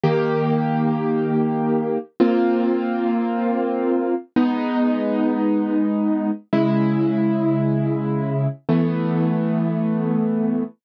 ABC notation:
X:1
M:4/4
L:1/8
Q:1/4=111
K:Abmix
V:1 name="Acoustic Grand Piano"
[E,B,=G]8 | [B,CF]8 | [A,_CE]8 | [D,A,_F]8 |
[=E,=A,=B,]8 |]